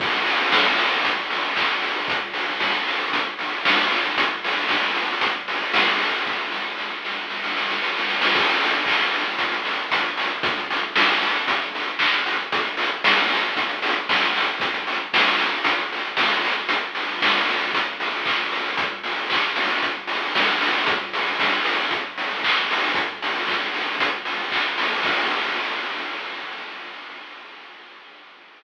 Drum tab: CC |x---------------|----------------|----------------|----------------|
HH |--o---o-x-o---o-|x-o---o-x-o---o-|x-o---o-x-o---o-|----------------|
CP |------------x---|----------------|----------------|----------------|
SD |----o-----------|----o-------o---|----o-------o---|o-o-o-o-oooooooo|
BD |o---o---o---o---|o---o---o---o---|o---o---o---o---|o---------------|

CC |x---------------|----------------|----------------|----------------|
HH |-xox-xoxxxoxxxox|xxox-xoxxxox-xox|xxox-xoxxxox-xox|xxox-xoxxxox-xox|
CP |----x-----------|------------x---|----------------|----------------|
SD |----------------|----o-----------|----o-------o---|----o-------o---|
BD |o---o---o---o---|o---o---o---o---|o---o---o---o---|o---o---o---o---|

CC |----------------|----------------|----------------|----------------|
HH |x-o---o-x-o---o-|x-o---o-x-o---o-|x-o---o-x-o---o-|x-o---o-x-o---o-|
CP |------------x---|----x-----------|------------x---|----x-------x---|
SD |----o-----------|------------o---|----o-----------|----------------|
BD |----o---o---o---|o---o---o---o---|o---o---o---o---|o---o---o---o---|

CC |x---------------|
HH |----------------|
CP |----------------|
SD |----------------|
BD |o---------------|